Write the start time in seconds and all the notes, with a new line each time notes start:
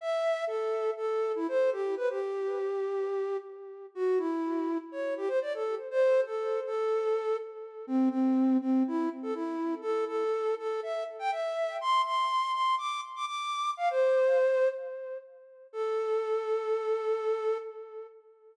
0.01 E5
0.47 A4
0.97 A4
1.35 E4
1.48 C5
1.72 G4
1.97 B4
2.10 G4
3.95 F#4
4.18 E4
4.92 C#5
5.17 G4
5.28 C5
5.42 D5
5.54 A4
5.91 C5
6.26 A4
6.66 A4
7.87 C4
8.10 C4
8.61 C4
8.87 E4
9.22 A4
9.34 E4
9.82 A4
10.07 A4
10.59 A4
10.83 E5
11.19 G5
11.31 E5
11.81 C6
12.05 C6
12.53 C6
12.78 D6
13.16 D6
13.26 D6
13.77 F5
13.90 C5
15.73 A4